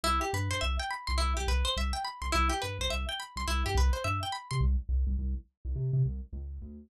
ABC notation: X:1
M:4/4
L:1/16
Q:"Swing 16ths" 1/4=105
K:Cmix
V:1 name="Synth Bass 1" clef=bass
C,,2 G,, G,, C,,3 C,, C,, C,, C,,2 C,,3 C,, | C,,2 G,, C,, C,,3 C,, C,, G,, C,,2 G,,3 C, | C,,2 C,, C,, C,,3 C,, C, C, C,,2 _D,,2 =D,,2 |]
V:2 name="Acoustic Guitar (steel)"
E G =B c e g =b c' E G B c e g b c' | E G =B c e g =b c' E G B c e g b c' | z16 |]